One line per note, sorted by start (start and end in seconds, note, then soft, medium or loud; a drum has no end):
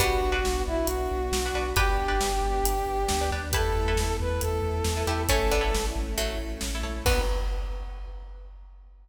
0.00 0.17 B1 medium
0.00 1.69 G3 medium
0.00 1.69 B3 medium
0.00 1.75 B3 medium
0.00 0.26 D4 loud
0.00 1.75 D4 medium
0.00 0.26 F#4 loud
0.00 0.62 F#4 loud
0.00 1.75 F#4 medium
0.00 0.26 B4 loud
0.00 kick medium
0.00 closed hi-hat loud
0.21 0.40 B1 medium
0.32 0.67 D4 loud
0.32 0.67 F#4 loud
0.32 0.67 B4 medium
0.44 0.63 B1 medium
0.44 snare medium
0.67 0.86 B1 medium
0.67 0.87 E4 loud
0.86 1.07 B1 medium
0.86 1.69 F#4 medium
0.86 closed hi-hat loud
1.11 1.30 B1 medium
1.32 1.51 B1 medium
1.32 snare loud
1.45 1.54 D4 medium
1.45 1.54 F#4 loud
1.45 1.54 B4 loud
1.54 1.73 B1 medium
1.54 1.73 D4 medium
1.54 1.73 F#4 loud
1.54 1.73 B4 loud
1.76 1.95 G1 medium
1.76 3.51 B3 medium
1.76 3.51 D4 medium
1.76 2.03 D4 loud
1.76 3.51 G4 medium
1.76 3.21 G4 medium
1.76 2.03 G4 loud
1.76 3.30 G4 loud
1.76 3.21 B4 medium
1.76 2.03 B4 loud
1.76 kick loud
1.76 closed hi-hat medium
1.98 2.17 G1 medium
2.08 2.44 D4 loud
2.08 2.44 G4 loud
2.08 2.44 B4 medium
2.21 2.40 G1 medium
2.21 snare loud
2.42 2.60 G1 medium
2.64 2.82 G1 medium
2.64 closed hi-hat loud
2.86 3.05 G1 medium
3.08 3.30 D2 medium
3.08 snare loud
3.21 3.30 D4 medium
3.21 3.30 G4 medium
3.21 3.30 B4 loud
3.31 3.51 D#2 medium
3.31 3.50 D4 medium
3.31 3.50 G4 loud
3.31 3.50 B4 loud
3.52 3.71 E2 medium
3.52 5.27 A3 medium
3.52 5.27 B3 medium
3.52 5.27 E4 medium
3.52 3.81 E4 loud
3.52 4.34 G4 medium
3.52 3.81 A4 loud
3.52 4.16 A4 loud
3.52 4.34 B4 medium
3.52 3.81 B4 loud
3.52 kick loud
3.52 closed hi-hat loud
3.75 3.94 E2 medium
3.88 4.23 E4 medium
3.88 4.23 A4 medium
3.88 4.23 B4 loud
3.96 4.15 E2 medium
3.96 snare loud
4.20 4.39 E2 medium
4.20 4.41 B4 loud
4.41 4.61 E2 medium
4.41 5.23 A4 loud
4.41 closed hi-hat medium
4.62 4.81 E2 medium
4.84 5.03 E2 medium
4.84 snare loud
4.97 5.06 E4 medium
4.97 5.06 A4 medium
4.97 5.06 B4 medium
5.07 5.26 E2 medium
5.07 5.27 E4 medium
5.07 5.26 E4 medium
5.07 5.27 G4 medium
5.07 5.26 A4 medium
5.07 5.26 B4 loud
5.29 5.48 A1 medium
5.29 5.51 A3 medium
5.29 7.04 A3 loud
5.29 5.51 C#4 medium
5.29 7.04 C#4 medium
5.29 5.56 E4 loud
5.29 7.04 E4 medium
5.29 5.56 A4 loud
5.29 5.86 A4 loud
5.29 5.56 C#5 loud
5.29 kick loud
5.29 closed hi-hat loud
5.51 5.71 A1 medium
5.51 6.16 B3 medium
5.51 6.16 D4 medium
5.61 5.96 E4 medium
5.61 5.96 A4 loud
5.61 5.96 C#5 medium
5.74 5.93 A1 medium
5.74 snare loud
5.95 6.14 A1 medium
6.18 6.36 A1 medium
6.18 6.38 F#3 medium
6.18 6.38 A3 medium
6.18 closed hi-hat medium
6.38 6.57 A1 medium
6.61 6.82 A1 medium
6.61 snare loud
6.75 6.83 E4 medium
6.75 6.83 A4 loud
6.75 6.83 C#5 medium
6.83 7.03 A#1 medium
6.83 7.01 E4 loud
6.83 7.01 A4 medium
6.83 7.01 C#5 medium
7.05 7.21 B1 loud
7.05 7.21 B3 loud
7.05 7.23 B3 loud
7.05 7.21 D4 loud
7.05 7.23 D4 loud
7.05 7.21 F#4 loud
7.05 7.23 F#4 loud
7.05 7.21 B4 loud
7.05 7.21 B4 medium
7.05 kick loud
7.05 crash loud